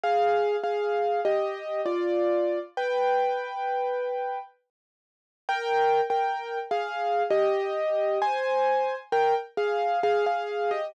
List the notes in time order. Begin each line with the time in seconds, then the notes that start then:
0.04 G#4 F5
0.64 G#4 F5
1.25 G4 D#5
1.86 F4 D5
2.77 B4 G5
5.49 A#4 G5
6.10 A#4 G5
6.71 G#4 F5
7.30 G4 D#5
8.22 C5 G#5
9.12 A#4 G5
9.57 G#4 F5
10.03 G#4 F5
10.26 G#4 F5
10.71 G4 D#5